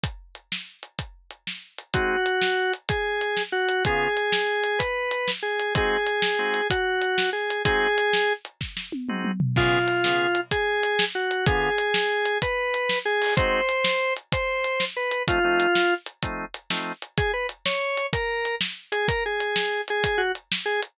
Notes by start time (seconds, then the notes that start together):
0.04 kick, closed hi-hat
0.35 closed hi-hat
0.52 snare
0.83 closed hi-hat
0.99 kick, closed hi-hat
1.31 closed hi-hat
1.47 snare
1.78 closed hi-hat
1.94 G#3 C4 D#4 F#4, kick, closed hi-hat
2.26 closed hi-hat
2.42 snare
2.74 closed hi-hat
2.89 G#4, kick, closed hi-hat
3.21 closed hi-hat
3.37 snare
3.52 F#4
3.69 closed hi-hat
3.85 C#3 B3 F4 G#4, kick, closed hi-hat
4.17 closed hi-hat
4.32 snare
4.64 closed hi-hat
4.79 B4, kick, closed hi-hat
5.11 closed hi-hat
5.28 snare
5.43 G#4
5.60 closed hi-hat
5.75 G#3 C4 D#4 F#4 G#4, kick, closed hi-hat
6.07 closed hi-hat
6.22 snare
6.39 G#3 C4 D#4 F#4
6.54 closed hi-hat
6.70 F#4, kick, closed hi-hat
7.02 closed hi-hat
7.18 snare
7.33 G#4
7.50 closed hi-hat
7.65 G#3 C4 D#4 F#4 G#4, kick, closed hi-hat
7.98 closed hi-hat
8.13 snare
8.45 closed hi-hat
8.61 kick, snare
8.77 snare
8.92 high tom
9.09 G#3 C4 D#4 F#4, mid tom
9.25 mid tom
9.40 floor tom
9.56 C#3 B3 F4 G#4, kick, crash
9.88 closed hi-hat
10.04 C#3 B3 F4 G#4, snare
10.35 closed hi-hat
10.51 G#4, kick, closed hi-hat
10.83 closed hi-hat
10.99 snare
11.15 F#4
11.31 closed hi-hat
11.46 D3 B3 F4 G#4, kick, closed hi-hat
11.78 closed hi-hat
11.94 snare
12.26 closed hi-hat
12.42 B4, kick, closed hi-hat
12.74 closed hi-hat
12.89 snare
13.05 G#4
13.22 open hi-hat
13.37 G#3 C4 D#4 F#4 C5, kick, closed hi-hat
13.69 closed hi-hat
13.84 snare
14.17 closed hi-hat
14.32 C5, kick, closed hi-hat
14.64 closed hi-hat
14.80 snare
14.96 B4
15.11 closed hi-hat
15.28 F3 A3 C4 D#4 F4, kick, closed hi-hat
15.44 F3 A3 C4 D#4
15.60 closed hi-hat
15.75 snare
16.06 closed hi-hat
16.23 F3 A3 C4 D#4, kick, closed hi-hat
16.54 closed hi-hat
16.70 F3 A3 C4 D#4, snare
17.02 closed hi-hat
17.18 G#4, kick, closed hi-hat
17.33 B4
17.49 closed hi-hat
17.66 C#5, snare
17.97 closed hi-hat
18.13 A#4, kick, closed hi-hat
18.45 closed hi-hat
18.61 snare
18.92 G#4, closed hi-hat
19.08 A#4, kick, closed hi-hat
19.26 G#4
19.40 closed hi-hat
19.56 snare
19.88 G#4, closed hi-hat
20.04 kick, closed hi-hat
20.18 F#4
20.35 closed hi-hat
20.52 snare
20.66 G#4
20.83 closed hi-hat